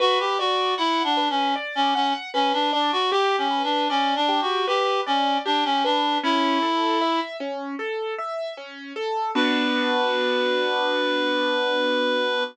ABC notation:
X:1
M:4/4
L:1/16
Q:1/4=77
K:Bm
V:1 name="Clarinet"
F G F2 (3E2 D2 C2 z C C z C D D F | (3G2 C2 D2 (3C2 D2 F2 G2 C2 D C D2 | E6 z10 | B16 |]
V:2 name="Acoustic Grand Piano"
B2 d2 f2 B2 d2 f2 B2 d2 | G2 B2 d2 G2 B2 d2 G2 B2 | C2 A2 e2 C2 A2 e2 C2 A2 | [B,DF]16 |]